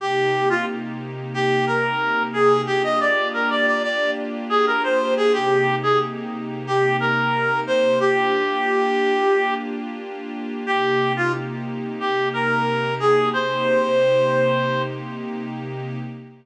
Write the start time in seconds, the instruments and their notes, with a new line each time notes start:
0.00 pad 5 (bowed) C3 A#3 D#4 G4, clarinet G4
0.50 clarinet F4
1.34 clarinet G4
1.67 clarinet A#4
2.33 clarinet G#4
2.67 pad 5 (bowed) A#3 D4 F4 G4, clarinet G4
2.84 clarinet D#5
3.00 clarinet D5
3.34 clarinet A#4
3.50 clarinet D5
3.67 clarinet D5
3.83 clarinet D5
4.49 clarinet G#4
4.67 clarinet A#4
4.83 clarinet C5
5.17 clarinet G#4
5.33 pad 5 (bowed) C3 A#3 D#4 G4, clarinet G4
5.83 clarinet G#4
6.67 clarinet G4
7.00 clarinet A#4
7.67 clarinet C5
8.00 pad 5 (bowed) A#3 D4 F4 G4, clarinet G4
10.66 pad 5 (bowed) C3 A#3 D#4 G4, clarinet G4
11.16 clarinet F4
12.00 clarinet G4
12.33 clarinet A#4
13.00 clarinet G#4
13.33 pad 5 (bowed) C3 A#3 D#4 G4, clarinet C5